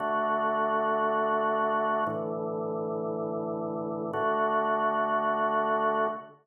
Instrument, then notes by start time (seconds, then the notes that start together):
drawbar organ
0.00 D3 A3 F#4
2.07 A2 D3 E3
4.13 D3 A3 F#4